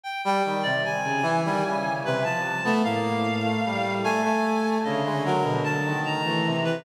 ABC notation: X:1
M:5/8
L:1/16
Q:1/4=75
K:none
V:1 name="Violin"
z4 | z _D, z _E, z5 A, | A,,4 z6 | D,6 z E,3 |]
V:2 name="Brass Section"
z G, _E, C, | z2 E, G, _D,2 C, F, z B, | _B,2 z A, G,2 A, A,3 | _D, _A, _G, B,, z _E,2 =A, C,2 |]
V:3 name="Clarinet"
g g2 d | _a6 B =a3 | f6 _a4 | _e2 _B2 a2 _b3 =B |]